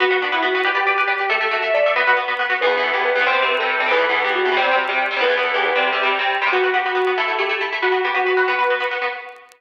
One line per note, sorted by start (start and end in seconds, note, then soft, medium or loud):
0.00 0.05 B3 loud
0.00 0.18 F#4 medium
0.00 0.05 F#4 medium
0.00 0.05 B4 loud
0.11 0.15 B3 medium
0.11 0.15 F#4 medium
0.11 0.15 B4 medium
0.22 0.26 B3 medium
0.22 0.31 D4 medium
0.22 0.26 F#4 medium
0.22 0.26 B4 medium
0.32 0.37 B3 medium
0.32 0.43 E4 medium
0.32 0.37 F#4 medium
0.32 0.37 B4 medium
0.43 0.47 B3 medium
0.43 0.47 F#4 medium
0.43 0.65 F#4 medium
0.43 0.47 B4 medium
0.55 0.59 B3 medium
0.55 0.59 F#4 medium
0.55 0.59 B4 medium
0.65 0.69 G4 loud
0.65 1.17 G4 medium
0.65 0.69 B4 medium
0.65 0.69 D5 medium
0.75 0.79 G4 medium
0.75 0.79 B4 medium
0.75 0.79 D5 medium
0.87 0.91 G4 medium
0.87 0.91 B4 medium
0.87 0.91 D5 medium
0.98 1.02 G4 medium
0.98 1.02 B4 medium
0.98 1.02 D5 medium
1.08 1.12 G4 medium
1.08 1.12 B4 medium
1.08 1.12 D5 medium
1.19 1.24 G4 medium
1.19 1.29 G4 medium
1.19 1.24 B4 medium
1.19 1.24 D5 medium
1.30 1.34 A3 loud
1.30 1.34 A4 loud
1.30 1.50 A4 medium
1.30 1.34 E5 loud
1.41 1.45 A3 medium
1.41 1.45 A4 medium
1.41 1.45 E5 medium
1.51 1.56 A3 medium
1.51 1.61 F#4 medium
1.51 1.56 A4 medium
1.51 1.56 E5 medium
1.62 1.66 A3 medium
1.62 1.66 A4 medium
1.62 1.66 E5 medium
1.62 1.73 E5 medium
1.74 1.79 A3 medium
1.74 1.79 A4 medium
1.74 1.94 D5 medium
1.74 1.79 E5 medium
1.86 1.90 A3 loud
1.86 1.90 A4 medium
1.86 1.90 E5 medium
1.96 2.00 B3 loud
1.96 2.00 F#4 loud
1.96 2.15 B4 medium
1.96 2.00 B4 loud
2.07 2.11 B3 medium
2.07 2.11 F#4 medium
2.07 2.11 B4 medium
2.17 2.21 B3 medium
2.17 2.21 F#4 medium
2.17 2.21 B4 medium
2.28 2.32 B3 medium
2.28 2.32 F#4 medium
2.28 2.32 B4 medium
2.39 2.44 B3 medium
2.39 2.44 F#4 medium
2.39 2.44 B4 medium
2.50 2.54 B3 medium
2.50 2.54 F#4 medium
2.50 2.54 B4 medium
2.61 2.66 E2 medium
2.61 2.66 E3 medium
2.61 2.66 B3 medium
2.61 2.80 B4 medium
2.67 2.76 E2 medium
2.67 2.76 E3 medium
2.67 2.76 B3 medium
2.77 2.90 E2 medium
2.77 2.90 E3 medium
2.77 2.90 B3 medium
2.83 2.92 A4 medium
2.93 3.11 E2 medium
2.93 3.11 E3 medium
2.93 3.11 B3 medium
2.93 3.02 G4 medium
3.04 3.23 B4 medium
3.15 3.20 E2 medium
3.15 3.20 E3 medium
3.15 3.20 B3 medium
3.20 3.25 E2 medium
3.20 3.25 E3 medium
3.20 3.25 B3 medium
3.26 3.31 C3 loud
3.26 3.31 G3 medium
3.26 3.31 C4 loud
3.26 3.44 C5 medium
3.33 3.42 C3 medium
3.33 3.42 G3 medium
3.33 3.42 C4 medium
3.42 3.55 C3 medium
3.42 3.55 G3 medium
3.42 3.55 C4 medium
3.48 3.57 B4 medium
3.59 3.78 C3 medium
3.59 3.78 G3 medium
3.59 3.78 C4 medium
3.59 3.89 A4 medium
3.80 3.84 C3 medium
3.80 3.84 G3 medium
3.80 3.84 C4 medium
3.86 3.90 C3 medium
3.86 3.90 G3 medium
3.86 3.90 C4 medium
3.91 3.95 E2 medium
3.91 3.95 E3 medium
3.91 3.95 B3 medium
3.91 4.09 B4 medium
3.97 4.06 E2 medium
3.97 4.06 E3 medium
3.97 4.06 B3 medium
4.09 4.22 E2 medium
4.09 4.22 E3 medium
4.09 4.22 B3 medium
4.09 4.23 A4 medium
4.24 4.42 E2 medium
4.24 4.42 E3 medium
4.24 4.42 B3 medium
4.24 4.33 G4 medium
4.35 4.55 F#4 medium
4.45 4.50 E2 medium
4.45 4.50 E3 medium
4.45 4.50 B3 medium
4.52 4.56 E2 medium
4.52 4.56 E3 medium
4.52 4.56 B3 medium
4.56 4.61 C3 medium
4.56 4.61 G3 medium
4.56 4.61 C4 medium
4.56 4.76 C5 medium
4.62 4.71 C3 medium
4.62 4.71 G3 medium
4.62 4.71 C4 medium
4.71 4.84 C3 medium
4.71 4.84 G3 medium
4.71 4.84 C4 medium
4.89 5.06 C3 medium
4.89 5.06 G3 medium
4.89 5.06 C4 medium
5.11 5.15 C3 medium
5.11 5.15 G3 medium
5.11 5.15 C4 medium
5.17 5.21 C3 medium
5.17 5.21 G3 medium
5.17 5.21 C4 medium
5.21 5.25 E2 medium
5.21 5.25 E3 medium
5.21 5.25 B3 medium
5.21 5.42 B4 medium
5.28 5.37 E2 medium
5.28 5.37 E3 medium
5.28 5.37 B3 medium
5.37 5.50 E2 medium
5.37 5.50 E3 medium
5.37 5.50 B3 medium
5.43 5.53 A4 medium
5.54 5.71 E2 medium
5.54 5.71 E3 medium
5.54 5.71 B3 medium
5.54 5.65 G4 medium
5.65 5.85 B4 medium
5.75 5.91 C3 medium
5.75 5.91 G3 medium
5.75 5.91 C4 loud
5.87 6.18 G4 medium
5.93 6.01 C3 medium
5.93 6.01 G3 medium
5.93 6.01 C4 medium
6.03 6.16 C3 medium
6.03 6.16 G3 medium
6.03 6.16 C4 medium
6.19 6.36 C3 medium
6.19 6.36 G3 medium
6.19 6.36 C4 medium
6.42 6.46 C3 medium
6.42 6.46 G3 medium
6.42 6.46 C4 medium
6.47 6.51 C3 medium
6.47 6.51 G3 medium
6.47 6.51 C4 medium
6.52 6.57 B3 medium
6.52 6.70 F#4 medium
6.52 6.57 F#4 medium
6.52 6.57 B4 medium
6.64 6.68 B3 medium
6.64 6.68 F#4 medium
6.64 6.68 B4 medium
6.74 6.78 B3 medium
6.74 6.78 F#4 medium
6.74 6.84 G4 medium
6.74 6.78 B4 medium
6.85 6.90 B3 medium
6.85 7.11 F#4 medium
6.85 6.90 F#4 medium
6.85 6.90 B4 medium
6.95 6.99 B3 medium
6.95 6.99 F#4 medium
6.95 6.99 B4 medium
7.07 7.11 B3 medium
7.07 7.11 F#4 medium
7.07 7.11 B4 medium
7.17 7.22 A3 medium
7.17 7.22 E4 medium
7.17 7.36 A4 medium
7.17 7.22 A4 medium
7.28 7.32 A3 medium
7.28 7.32 E4 medium
7.28 7.32 A4 medium
7.39 7.43 A3 medium
7.39 7.43 E4 medium
7.39 7.49 G4 medium
7.39 7.43 A4 medium
7.49 7.54 A3 medium
7.49 7.54 E4 medium
7.49 7.54 A4 medium
7.61 7.65 A3 medium
7.61 7.65 E4 medium
7.61 7.65 A4 medium
7.72 7.77 A3 medium
7.72 7.77 E4 medium
7.72 7.77 A4 medium
7.82 7.87 B3 medium
7.82 7.87 F#4 medium
7.82 8.01 F#4 medium
7.82 7.87 B4 medium
7.92 7.96 B3 medium
7.92 7.96 F#4 medium
7.92 7.96 B4 medium
8.04 8.09 B3 medium
8.04 8.09 F#4 medium
8.04 8.13 G4 medium
8.04 8.09 B4 medium
8.14 8.19 B3 medium
8.14 8.19 F#4 medium
8.14 8.45 F#4 medium
8.14 8.19 B4 medium
8.26 8.31 B3 medium
8.26 8.31 F#4 medium
8.26 8.31 B4 medium
8.37 8.41 B3 medium
8.37 8.41 F#4 medium
8.37 8.41 B4 medium
8.48 8.52 B3 medium
8.48 8.52 F#4 medium
8.48 8.52 B4 medium
8.48 8.75 B4 medium
8.59 8.63 B3 medium
8.59 8.63 F#4 medium
8.59 8.63 B4 medium
8.70 8.75 B3 medium
8.70 8.75 F#4 medium
8.70 8.75 B4 medium
8.80 8.85 B3 medium
8.80 8.85 F#4 medium
8.80 8.85 B4 medium
8.91 8.95 B3 medium
8.91 8.95 F#4 medium
8.91 8.95 B4 medium
9.02 9.06 B3 medium
9.02 9.06 F#4 medium
9.02 9.06 B4 medium